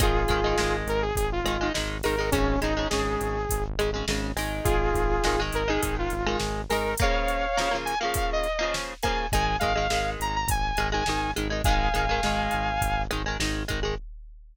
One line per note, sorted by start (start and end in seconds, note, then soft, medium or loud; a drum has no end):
0.00 0.26 G#1 loud
0.00 0.23 D#3 medium
0.00 0.23 G#3 medium
0.00 0.76 F4 medium
0.00 0.76 G#4 medium
0.00 kick loud
0.00 closed hi-hat loud
0.28 0.54 G#1 loud
0.28 0.40 D#3 medium
0.28 0.40 G#3 medium
0.28 kick medium
0.28 closed hi-hat medium
0.44 0.56 D#3 medium
0.44 0.56 G#3 medium
0.58 0.84 G#1 medium
0.58 1.05 D#3 medium
0.58 1.05 G#3 medium
0.58 snare loud
0.87 1.12 G#1 loud
0.87 1.02 A#4 medium
0.87 closed hi-hat medium
1.02 1.16 G#4 medium
1.16 1.41 G#1 medium
1.16 1.30 G#4 medium
1.16 kick medium
1.16 closed hi-hat loud
1.32 1.69 F4 medium
1.44 1.69 G#1 medium
1.44 1.57 D#3 medium
1.44 1.57 G#3 medium
1.44 closed hi-hat medium
1.61 1.72 D#3 medium
1.61 1.72 G#3 medium
1.74 2.01 G#1 medium
1.74 1.98 D#3 medium
1.74 1.98 G#3 medium
1.74 snare loud
2.03 2.30 G#1 medium
2.03 2.15 D#3 medium
2.03 2.15 G#3 medium
2.03 2.30 A#4 medium
2.03 open hi-hat medium
2.18 2.30 D#3 medium
2.18 2.30 G#3 medium
2.31 2.57 G#1 loud
2.31 2.56 C#3 medium
2.31 2.56 G#3 medium
2.31 2.60 C#4 medium
2.31 kick loud
2.31 closed hi-hat loud
2.61 2.86 G#1 medium
2.61 2.73 C#3 medium
2.61 2.73 G#3 medium
2.61 2.87 D#4 medium
2.61 closed hi-hat medium
2.77 2.88 C#3 medium
2.77 2.88 G#3 medium
2.90 3.17 G#1 medium
2.90 3.38 C#3 medium
2.90 3.38 G#3 medium
2.90 3.63 G#4 medium
2.90 snare loud
3.21 3.46 G#1 medium
3.21 closed hi-hat medium
3.49 3.75 G#1 medium
3.49 kick medium
3.49 closed hi-hat loud
3.78 4.03 G#1 medium
3.78 3.91 C#3 medium
3.78 3.91 G#3 medium
3.78 closed hi-hat medium
3.94 4.05 C#3 medium
3.94 4.05 G#3 medium
4.08 4.33 G#1 loud
4.08 4.32 C#3 medium
4.08 4.32 G#3 medium
4.08 snare loud
4.36 4.61 G#1 medium
4.36 5.12 D#3 medium
4.36 5.12 G#3 medium
4.36 open hi-hat medium
4.64 4.91 G#1 loud
4.64 5.40 F4 medium
4.64 5.40 G#4 medium
4.64 kick loud
4.64 closed hi-hat loud
4.94 5.19 G#1 medium
4.94 kick medium
4.94 closed hi-hat medium
5.24 5.50 G#1 medium
5.24 5.36 D#3 medium
5.24 5.36 G#3 medium
5.24 snare loud
5.40 5.63 D#3 medium
5.40 5.63 G#3 medium
5.52 5.78 G#1 medium
5.52 5.68 A#4 medium
5.52 closed hi-hat medium
5.68 6.14 D#3 medium
5.68 6.14 G#3 medium
5.68 5.81 G#4 medium
5.82 6.08 G#1 medium
5.82 5.95 G#4 medium
5.82 kick medium
5.82 closed hi-hat loud
5.99 6.38 F4 medium
6.10 6.36 G#1 medium
6.10 closed hi-hat medium
6.26 6.61 D#3 medium
6.26 6.61 G#3 medium
6.40 6.65 G#1 medium
6.40 snare loud
6.69 6.95 G#1 medium
6.69 6.94 D#3 medium
6.69 6.94 G#3 medium
6.69 6.95 A#4 medium
6.69 open hi-hat medium
6.97 7.46 A#3 medium
6.97 7.76 C#5 medium
6.97 7.76 F5 medium
6.97 kick loud
6.97 closed hi-hat loud
7.01 7.46 C#3 medium
7.01 7.46 F3 medium
7.28 closed hi-hat medium
7.57 7.69 C#3 medium
7.57 7.69 F3 medium
7.57 7.69 A#3 medium
7.57 snare loud
7.71 7.94 C#3 medium
7.71 7.94 F3 medium
7.71 7.94 A#3 medium
7.85 7.99 G#5 medium
7.85 closed hi-hat medium
8.00 8.47 F3 medium
8.00 8.47 A#3 medium
8.00 8.14 F5 medium
8.04 8.47 C#3 medium
8.14 8.30 F5 medium
8.14 kick loud
8.14 closed hi-hat loud
8.32 8.73 D#5 medium
8.44 closed hi-hat medium
8.59 8.94 C#3 medium
8.59 8.94 F3 medium
8.59 8.94 A#3 medium
8.74 snare loud
9.03 9.26 F3 medium
9.03 9.26 A#3 medium
9.03 9.27 G#5 medium
9.03 kick medium
9.03 closed hi-hat medium
9.07 9.26 C#3 medium
9.32 9.57 G#1 medium
9.32 9.56 D#3 medium
9.32 9.56 G#3 medium
9.32 9.56 G#5 medium
9.32 kick loud
9.32 closed hi-hat loud
9.59 9.88 G#1 medium
9.59 9.73 D#3 medium
9.59 9.73 G#3 medium
9.59 10.10 F5 medium
9.59 kick medium
9.59 closed hi-hat medium
9.75 9.87 D#3 medium
9.75 9.87 G#3 medium
9.90 10.16 G#1 medium
9.90 10.37 D#3 medium
9.90 10.37 G#3 medium
9.90 snare loud
10.20 10.45 G#1 medium
10.20 10.35 A#5 medium
10.20 closed hi-hat medium
10.35 10.49 A#5 medium
10.47 10.72 G#1 medium
10.47 10.88 G#5 medium
10.47 kick loud
10.47 closed hi-hat loud
10.77 11.03 G#1 medium
10.77 10.90 D#3 medium
10.77 10.90 G#3 medium
10.77 closed hi-hat medium
10.92 11.04 D#3 medium
10.92 11.04 G#3 medium
10.92 11.31 G#5 medium
11.06 11.33 G#1 medium
11.06 11.31 D#3 medium
11.06 11.31 G#3 medium
11.06 snare loud
11.36 11.61 G#1 loud
11.36 11.48 D#3 medium
11.36 11.48 G#3 medium
11.36 closed hi-hat medium
11.50 11.62 D#3 medium
11.50 11.62 G#3 medium
11.64 11.89 G#1 loud
11.64 11.89 D#3 medium
11.64 11.89 G#3 medium
11.64 13.02 F5 medium
11.64 13.02 G#5 medium
11.64 kick loud
11.64 closed hi-hat loud
11.94 12.19 G#1 loud
11.94 12.05 D#3 medium
11.94 12.05 G#3 medium
11.94 closed hi-hat medium
12.09 12.21 D#3 medium
12.09 12.21 G#3 medium
12.23 12.48 G#1 medium
12.23 12.70 D#3 medium
12.23 12.70 G#3 medium
12.23 snare loud
12.51 12.79 G#1 medium
12.51 closed hi-hat medium
12.81 13.06 G#1 loud
12.81 kick medium
12.81 closed hi-hat loud
13.11 13.36 G#1 medium
13.11 13.22 D#3 medium
13.11 13.22 G#3 medium
13.11 closed hi-hat medium
13.26 13.37 D#3 medium
13.26 13.37 G#3 medium
13.40 13.64 G#1 loud
13.40 13.63 D#3 medium
13.40 13.63 G#3 medium
13.40 snare loud
13.68 13.95 G#1 medium
13.68 13.80 D#3 medium
13.68 13.80 G#3 medium
13.68 kick medium
13.68 closed hi-hat medium
13.83 13.95 D#3 medium
13.83 13.95 G#3 medium